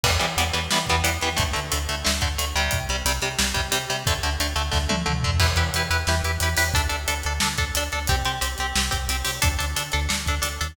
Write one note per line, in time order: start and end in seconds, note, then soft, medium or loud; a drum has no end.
0.03 0.18 E2 medium
0.03 0.11 E3 medium
0.03 0.11 G3 loud
0.03 0.11 B3 medium
0.03 kick loud
0.03 crash loud
0.19 0.35 E2 medium
0.19 0.26 E3 medium
0.19 0.26 G3 medium
0.19 0.26 B3 medium
0.19 closed hi-hat medium
0.37 0.51 E2 medium
0.37 0.44 E3 medium
0.37 0.44 G3 medium
0.37 0.44 B3 medium
0.37 closed hi-hat medium
0.53 0.68 E2 medium
0.53 0.60 E3 medium
0.53 0.60 G3 medium
0.53 0.60 B3 medium
0.53 closed hi-hat medium
0.71 0.86 E2 medium
0.71 0.78 E3 medium
0.71 0.78 G3 medium
0.71 0.78 B3 medium
0.71 snare medium
0.86 1.02 E2 medium
0.86 0.96 E3 medium
0.86 0.96 G3 medium
0.86 0.96 B3 medium
0.86 kick medium
0.86 closed hi-hat medium
1.04 1.18 E2 medium
1.04 1.10 E3 medium
1.04 1.10 G3 medium
1.04 1.10 B3 medium
1.04 closed hi-hat loud
1.21 1.36 E2 medium
1.21 1.29 E3 medium
1.21 1.29 G3 medium
1.21 1.29 B3 medium
1.21 closed hi-hat medium
1.37 1.53 D2 medium
1.37 1.43 D3 medium
1.37 1.43 A3 medium
1.37 kick medium
1.37 closed hi-hat medium
1.53 1.70 D2 medium
1.53 1.60 D3 medium
1.53 1.60 A3 medium
1.53 closed hi-hat medium
1.72 1.87 D2 medium
1.72 1.78 D3 medium
1.72 1.78 A3 medium
1.72 closed hi-hat loud
1.89 2.03 D2 medium
1.89 1.95 D3 medium
1.89 1.95 A3 medium
1.89 closed hi-hat medium
2.05 2.21 D2 medium
2.05 2.11 D3 medium
2.05 2.11 A3 medium
2.05 snare loud
2.21 2.37 D2 medium
2.21 2.28 D3 medium
2.21 2.28 A3 medium
2.21 kick medium
2.21 closed hi-hat medium
2.38 2.53 D2 medium
2.38 2.45 D3 medium
2.38 2.45 A3 medium
2.38 closed hi-hat medium
2.55 2.69 D2 medium
2.55 2.79 C3 medium
2.55 2.79 G3 loud
2.55 closed hi-hat medium
2.71 2.86 C2 medium
2.71 kick medium
2.71 closed hi-hat medium
2.89 3.03 C2 medium
2.89 2.96 C3 medium
2.89 2.96 G3 medium
2.89 closed hi-hat medium
3.05 3.19 C2 medium
3.05 3.12 C3 medium
3.05 3.12 G3 medium
3.05 closed hi-hat loud
3.22 3.36 C2 medium
3.22 3.29 C3 medium
3.22 3.29 G3 medium
3.22 closed hi-hat medium
3.38 3.53 C2 medium
3.38 3.45 C3 medium
3.38 3.45 G3 medium
3.38 snare loud
3.54 3.70 C2 medium
3.54 3.61 C3 medium
3.54 3.61 G3 medium
3.54 kick medium
3.54 closed hi-hat medium
3.72 3.86 C2 medium
3.72 3.78 C3 medium
3.72 3.78 G3 medium
3.72 closed hi-hat loud
3.90 4.04 C2 medium
3.90 3.96 C3 medium
3.90 3.96 G3 medium
3.90 closed hi-hat medium
4.06 4.20 D2 medium
4.06 4.14 D3 loud
4.06 4.14 A3 medium
4.06 kick loud
4.06 closed hi-hat medium
4.23 4.37 D2 medium
4.23 4.30 D3 medium
4.23 4.30 A3 medium
4.23 closed hi-hat medium
4.40 4.54 D2 medium
4.40 4.47 D3 medium
4.40 4.47 A3 medium
4.40 closed hi-hat medium
4.56 4.70 D2 medium
4.56 4.62 D3 medium
4.56 4.62 A3 medium
4.56 closed hi-hat medium
4.72 4.88 D2 medium
4.72 4.78 D3 medium
4.72 4.78 A3 medium
4.72 kick medium
4.72 snare medium
4.89 5.05 D2 medium
4.89 4.96 D3 medium
4.89 4.96 A3 medium
4.89 high tom medium
5.06 5.22 D2 medium
5.06 5.13 D3 medium
5.06 5.13 A3 medium
5.06 mid tom medium
5.23 5.39 D2 medium
5.23 5.31 D3 medium
5.23 5.31 A3 medium
5.23 floor tom medium
5.40 5.55 E2 medium
5.40 5.47 E4 medium
5.40 5.47 G4 medium
5.40 5.47 B4 medium
5.40 kick medium
5.40 crash medium
5.56 5.70 E2 medium
5.56 5.64 E4 medium
5.56 5.64 G4 medium
5.56 5.64 B4 medium
5.56 closed hi-hat medium
5.74 5.88 E2 medium
5.74 5.82 E4 medium
5.74 5.82 G4 medium
5.74 5.82 B4 medium
5.74 closed hi-hat medium
5.90 6.05 E2 medium
5.90 5.97 E4 medium
5.90 5.97 G4 medium
5.90 5.97 B4 medium
5.90 closed hi-hat medium
6.07 6.21 E2 medium
6.07 6.15 E4 medium
6.07 6.15 G4 medium
6.07 6.15 B4 medium
6.07 snare medium
6.23 6.38 E2 medium
6.23 6.31 E4 medium
6.23 6.31 G4 medium
6.23 6.31 B4 medium
6.23 closed hi-hat medium
6.40 6.55 E2 medium
6.40 6.49 E4 medium
6.40 6.49 G4 medium
6.40 6.49 B4 medium
6.40 closed hi-hat medium
6.56 6.72 E2 medium
6.56 6.64 E4 medium
6.56 6.64 G4 medium
6.56 6.64 B4 medium
6.56 open hi-hat medium
6.74 6.88 D2 medium
6.74 6.81 D4 medium
6.74 6.81 A4 medium
6.74 kick medium
6.74 closed hi-hat medium
6.89 7.06 D2 medium
6.89 6.96 D4 medium
6.89 6.96 A4 medium
6.89 closed hi-hat medium
7.08 7.23 D2 medium
7.08 7.14 D4 medium
7.08 7.14 A4 medium
7.08 closed hi-hat medium
7.23 7.39 D2 medium
7.23 7.33 D4 medium
7.23 7.33 A4 medium
7.23 closed hi-hat medium
7.40 7.57 D2 medium
7.40 7.48 D4 medium
7.40 7.48 A4 medium
7.40 snare loud
7.58 7.72 D2 medium
7.58 7.65 D4 medium
7.58 7.65 A4 medium
7.58 kick medium
7.58 closed hi-hat medium
7.75 7.89 D2 medium
7.75 7.84 D4 medium
7.75 7.84 A4 medium
7.75 closed hi-hat loud
7.92 8.07 D2 medium
7.92 7.99 D4 medium
7.92 7.99 A4 medium
7.92 closed hi-hat medium
8.07 8.23 C2 medium
8.07 8.16 C4 loud
8.07 8.16 G4 medium
8.07 kick medium
8.07 closed hi-hat medium
8.25 8.39 C2 medium
8.25 8.32 C4 medium
8.25 8.32 G4 medium
8.25 closed hi-hat medium
8.41 8.56 C2 medium
8.41 8.48 C4 medium
8.41 8.48 G4 medium
8.41 closed hi-hat medium
8.58 8.73 C2 medium
8.58 8.67 C4 medium
8.58 8.67 G4 medium
8.58 closed hi-hat medium
8.75 8.90 C2 medium
8.75 8.84 C4 medium
8.75 8.84 G4 medium
8.75 snare loud
8.91 9.08 C2 medium
8.91 8.98 C4 medium
8.91 8.98 G4 medium
8.91 kick medium
8.91 closed hi-hat medium
9.09 9.23 C2 medium
9.09 9.17 C4 medium
9.09 9.17 G4 medium
9.09 closed hi-hat medium
9.25 9.40 C2 medium
9.25 9.31 C4 medium
9.25 9.31 G4 medium
9.25 open hi-hat medium
9.42 9.57 D2 medium
9.42 9.49 D4 medium
9.42 9.49 A4 loud
9.42 kick loud
9.42 closed hi-hat loud
9.59 9.75 D2 medium
9.59 9.65 D4 medium
9.59 9.65 A4 medium
9.59 closed hi-hat medium
9.76 9.90 D2 medium
9.76 9.83 D4 medium
9.76 9.83 A4 medium
9.76 closed hi-hat medium
9.92 10.08 D2 medium
9.92 10.00 D4 medium
9.92 10.00 A4 medium
9.92 closed hi-hat medium
10.09 10.25 D2 medium
10.09 10.16 D4 medium
10.09 10.16 A4 medium
10.09 snare medium
10.26 10.40 D2 medium
10.26 10.35 D4 medium
10.26 10.35 A4 medium
10.26 kick medium
10.26 closed hi-hat medium
10.42 10.58 D2 medium
10.42 10.48 D4 medium
10.42 10.48 A4 medium
10.42 closed hi-hat loud
10.61 10.76 D#2 medium
10.61 10.67 D4 medium
10.61 10.67 A4 medium
10.61 closed hi-hat medium